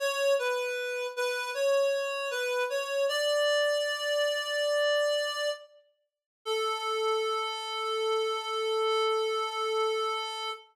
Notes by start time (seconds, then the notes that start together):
0.00 C#5
0.39 B4
1.16 B4
1.54 C#5
2.31 B4
2.70 C#5
3.09 D5
6.45 A4